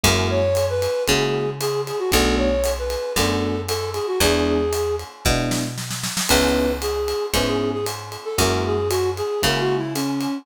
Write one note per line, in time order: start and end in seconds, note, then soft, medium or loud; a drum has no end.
0.03 0.87 F#2 loud
0.03 0.40 G#3 loud
0.03 0.40 A#3 loud
0.03 0.40 E4 loud
0.03 0.40 F#4 loud
0.03 0.28 A#4 loud
0.03 kick medium
0.03 ride loud
0.30 0.66 C#5 loud
0.55 hi-hat pedal medium
0.55 ride loud
0.70 1.03 B4 loud
0.82 ride loud
1.07 1.92 C#3 medium
1.07 1.45 G#3 medium
1.07 1.45 A#3 loud
1.07 1.45 E4 medium
1.07 1.45 F#4 loud
1.07 1.50 G#4 medium
1.07 kick medium
1.07 ride loud
1.60 1.82 G#4 loud
1.60 hi-hat pedal loud
1.60 ride loud
1.87 1.99 G#4 medium
1.87 ride medium
1.99 2.11 F#4 medium
2.12 2.97 B1 medium
2.12 2.48 A3 loud
2.12 2.48 B3 loud
2.12 2.48 D4 loud
2.12 2.48 F#4 loud
2.12 2.36 A4 loud
2.12 kick medium
2.12 ride loud
2.37 2.72 C#5 medium
2.64 hi-hat pedal loud
2.64 ride loud
2.78 3.13 B4 medium
2.90 ride medium
3.16 4.00 F#2 medium
3.16 3.53 A3 medium
3.16 3.53 B3 medium
3.16 3.53 D4 loud
3.16 3.53 F#4 medium
3.16 3.61 A4 medium
3.16 kick medium
3.16 ride loud
3.68 3.90 A4 loud
3.68 hi-hat pedal medium
3.68 ride loud
3.94 4.06 G#4 medium
3.94 ride medium
4.07 4.19 F#4 medium
4.20 5.04 E2 medium
4.20 4.58 G#3 loud
4.20 4.58 B3 loud
4.20 4.58 D4 loud
4.20 4.58 E4 loud
4.20 4.96 G#4 loud
4.20 kick medium
4.20 ride loud
4.73 hi-hat pedal loud
4.73 ride loud
4.99 ride medium
5.25 6.09 B2 medium
5.25 5.62 G#3 loud
5.25 5.62 B3 loud
5.25 5.62 D4 loud
5.25 5.62 E4 loud
5.25 kick loud
5.25 snare medium
5.51 snare loud
5.78 snare medium
5.91 snare medium
6.03 snare loud
6.17 snare loud
6.29 7.14 C#2 medium
6.29 6.67 B3 loud
6.29 6.67 C#4 loud
6.29 6.67 D#4 loud
6.29 6.67 E4 loud
6.29 6.72 B4 loud
6.29 kick medium
6.29 crash loud
6.29 ride loud
6.81 7.26 G#4 medium
6.81 hi-hat pedal medium
6.81 ride loud
7.08 ride medium
7.33 8.17 G#2 medium
7.33 7.71 B3 medium
7.33 7.71 C#4 loud
7.33 7.71 D#4 loud
7.33 7.71 E4 loud
7.33 7.46 B4 medium
7.33 kick medium
7.33 ride loud
7.46 7.70 G#4 medium
7.73 7.85 G#4 medium
7.86 hi-hat pedal loud
7.86 ride loud
8.12 ride medium
8.25 8.37 A4 medium
8.38 9.22 F#2 medium
8.38 8.74 G#3 loud
8.38 8.74 A#3 loud
8.38 8.74 E4 loud
8.38 8.74 F#4 loud
8.38 8.64 A#4 loud
8.38 kick medium
8.38 ride loud
8.66 8.89 G#4 medium
8.89 9.10 F#4 loud
8.89 hi-hat pedal loud
8.89 ride loud
9.16 9.42 G#4 medium
9.16 ride medium
9.42 10.27 C#3 medium
9.42 9.79 G#3 loud
9.42 9.79 A#3 loud
9.42 9.79 E4 loud
9.42 9.79 F#4 loud
9.42 9.61 A#4 medium
9.42 kick medium
9.42 ride loud
9.59 9.76 F#4 loud
9.77 9.94 E4 medium
9.94 10.38 C#4 medium
9.94 hi-hat pedal loud
9.94 ride loud
10.21 ride medium